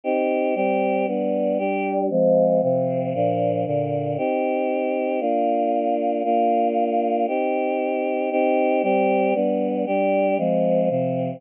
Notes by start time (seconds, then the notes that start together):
0.04 C4 D#4 G4
0.55 G3 C4 G4
1.07 G3 B3 D4
1.58 G3 D4 G4
2.10 F3 G#3 C4
2.62 C3 F3 C4
3.14 A#2 F3 D4
3.66 A#2 D3 D4
4.18 C4 D#4 G4
5.20 A#3 D4 F4
6.24 A#3 D4 F4
7.28 C4 D#4 G4
8.31 C4 D#4 G4
8.83 G3 C4 G4
9.34 G3 B3 D4
9.86 G3 D4 G4
10.38 F3 G#3 C4
10.90 C3 F3 C4